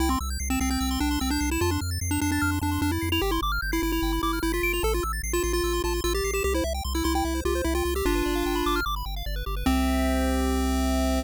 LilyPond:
<<
  \new Staff \with { instrumentName = "Lead 1 (square)" } { \time 4/4 \key c \major \tempo 4 = 149 e'16 c'16 r8. c'16 c'16 c'8. d'8 c'16 d'8 e'16 | f'16 d'16 r8. d'16 d'16 d'8. d'8 d'16 e'8 e'16 | g'16 e'16 r8. e'16 e'16 e'8. e'8 e'16 f'8 f'16 | a'16 f'16 r8. f'16 f'16 f'8. f'8 f'16 g'8 g'16 |
g'16 e'16 r8. e'16 e'16 e'8. f'8 e'16 f'8 g'16 | <d' f'>2 r2 | c'1 | }
  \new Staff \with { instrumentName = "Lead 1 (square)" } { \time 4/4 \key c \major g''16 c'''16 e'''16 g'''16 c''''16 e''''16 c''''16 g'''16 e'''16 c'''16 g''16 c'''16 e'''16 g'''16 c''''16 e''''16 | a''16 c'''16 f'''16 a'''16 c''''16 f''''16 c''''16 a'''16 f'''16 c'''16 a''16 c'''16 f'''16 a'''16 c''''16 f''''16 | g''16 c'''16 d'''16 f'''16 g'''16 c''''16 d''''16 f''''16 g''16 b''16 d'''16 f'''16 g'''16 b'''16 d''''16 f''''16 | a''16 c'''16 e'''16 a'''16 c''''16 e''''16 c''''16 a'''16 e'''16 c'''16 a''16 c'''16 e'''16 a'''16 c''''16 e''''16 |
g'16 c''16 e''16 g''16 c'''16 e'''16 c'''16 g''16 e''16 c''16 g'16 c''16 e''16 g''16 c'''16 e'''16 | g'16 b'16 d''16 f''16 g''16 b''16 d'''16 f'''16 d'''16 b''16 g''16 f''16 d''16 b'16 g'16 b'16 | <g' c'' e''>1 | }
  \new Staff \with { instrumentName = "Synth Bass 1" } { \clef bass \time 4/4 \key c \major c,8 c,8 c,8 c,8 c,8 c,8 c,8 c,8 | f,8 f,8 f,8 f,8 f,8 f,8 f,8 f,8 | g,,8 g,,8 g,,8 g,,8 g,,8 g,,8 g,,8 g,,8 | a,,8 a,,8 a,,8 a,,8 a,,8 a,,8 a,,8 a,,8 |
c,8 c,8 c,8 c,8 c,8 c,8 c,8 c,8 | g,,8 g,,8 g,,8 g,,8 g,,8 g,,8 g,,8 g,,8 | c,1 | }
>>